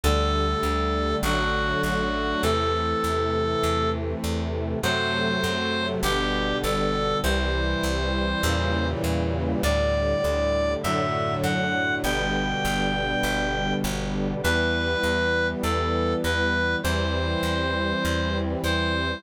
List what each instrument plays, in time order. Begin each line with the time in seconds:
0.04 electric bass (finger) D2, brass section D3 G3 A3, clarinet A4
0.63 electric bass (finger) D2
1.23 electric bass (finger) A1, brass section D3 F#3 A3, clarinet F#4
1.83 electric bass (finger) A1, clarinet F#4
2.42 electric bass (finger) E2, brass section C3 E3 A3, clarinet A4
3.04 electric bass (finger) E2
3.63 electric bass (finger) E2
4.24 electric bass (finger) E2
4.82 electric bass (finger) F#2, brass section C3 F#3 A3, clarinet C5
5.44 electric bass (finger) F#2
6.03 electric bass (finger) G1, brass section B2 D3 G3, clarinet G4
6.63 electric bass (finger) G1, clarinet A4
7.23 electric bass (finger) C2, brass section C3 E3 G3, clarinet C5
7.83 electric bass (finger) C2
8.43 electric bass (finger) E2, brass section A#2 C#3 E3 G3
9.04 electric bass (finger) E2
9.63 electric bass (finger) D2, brass section A2 D3 G3, clarinet D5
10.24 electric bass (finger) D2
10.83 electric bass (finger) F#2, brass section A2 D3 F#3, clarinet E5
11.43 electric bass (finger) F#2, clarinet F#5
12.04 electric bass (finger) G1, brass section B2 D3 G3, clarinet G5
12.65 electric bass (finger) G1
13.23 electric bass (finger) G1
13.84 electric bass (finger) G1
14.43 electric bass (finger) E2, brass section E3 G3 B3, clarinet B4
15.04 electric bass (finger) E2
15.63 electric bass (finger) E2, clarinet A4
16.24 electric bass (finger) E2, clarinet B4
16.83 electric bass (finger) E2, brass section E3 G3 C4, clarinet C5
17.43 electric bass (finger) E2
18.05 electric bass (finger) E2
18.64 electric bass (finger) E2, clarinet C5